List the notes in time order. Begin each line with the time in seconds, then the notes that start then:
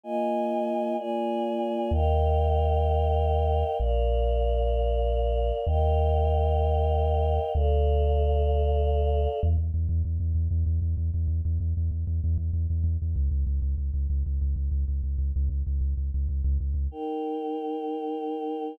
0.04 A#3 F4 D#5 G#5
0.98 A#3 F4 D5 G#5
1.91 D#2 A#4 D#5 F5 G5
3.79 A#1 A#4 D5 F5
5.66 D#2 A#4 D#5 F5 G5
7.54 D2 A4 D5 F5
9.43 E2
9.58 E2
9.74 E2
9.89 E2
10.05 E2
10.20 E2
10.35 E2
10.51 E2
10.66 E2
10.82 E2
10.97 E2
11.14 E2
11.28 E2
11.45 E2
11.60 E2
11.77 E2
11.91 E2
12.07 E2
12.24 E2
12.38 E2
12.53 E2
12.70 E2
12.84 E2
13.02 E2
13.16 C#2
13.31 C#2
13.47 C#2
13.62 C#2
13.78 C#2
13.94 C#2
14.10 C#2
14.26 C#2
14.41 C#2
14.56 C#2
14.71 C#2
14.88 C#2
15.03 C#2
15.18 C#2
15.36 C#2
15.49 C#2
15.67 C#2
15.81 C#2
15.97 C#2
16.14 C#2
16.29 C#2
16.44 C#2
16.60 C#2
16.74 C#2
16.91 D#4 A#4 G5